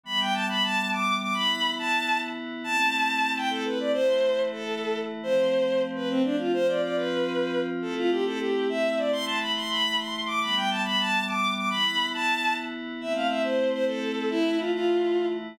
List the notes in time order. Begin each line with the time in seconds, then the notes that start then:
0.03 E3 G3 B3 B5
0.20 G5
0.34 A5
0.49 B5
0.63 A5
0.91 D6
1.21 D6
1.34 E3 B3 E4 B5
1.79 A5
2.64 A3 C4 E4 A5
3.36 G5
3.50 A4
3.66 B4
3.80 D5
3.93 E3 A3 E4 C5
4.52 A4
5.22 F3 A3 C4 C5
5.95 B4
6.10 C4
6.24 D4
6.38 F4
6.53 F3 C4 F4 C5
6.68 D5
6.82 D5
6.95 B4
7.82 A3 C4 E4 A4
7.97 F4
8.11 G4
8.26 A4
8.39 G4
8.69 E5
8.97 D5
9.12 E3 A3 E4 C6
9.26 A5
9.40 B5
9.55 C6
9.70 B5
9.98 C6
10.27 D6
10.41 E3 G3 B3 B5
10.56 G5
10.70 A5
10.85 B5
10.99 A5
11.27 D6
11.56 D6
11.70 E3 B3 E4 B5
12.14 A5
13.00 A3 C4 E4 E5
13.15 F5
13.29 E5
13.43 C5
13.72 C5
13.87 A4
14.29 E3 A3 E4
14.59 F4
14.73 F4